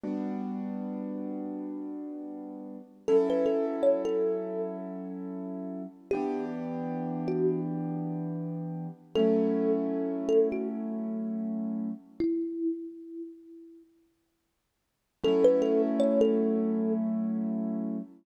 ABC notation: X:1
M:4/4
L:1/16
Q:"Swing 16ths" 1/4=79
K:F#phr
V:1 name="Kalimba"
z16 | A B A z c A4 z7 | G2 z4 F2 z8 | A6 A F z8 |
E10 z6 | A B A z c A4 z7 |]
V:2 name="Acoustic Grand Piano"
[G,B,DF]16 | [F,CEA]16 | [E,B,DG]16 | [F,A,CE]16 |
z16 | [F,A,CE]16 |]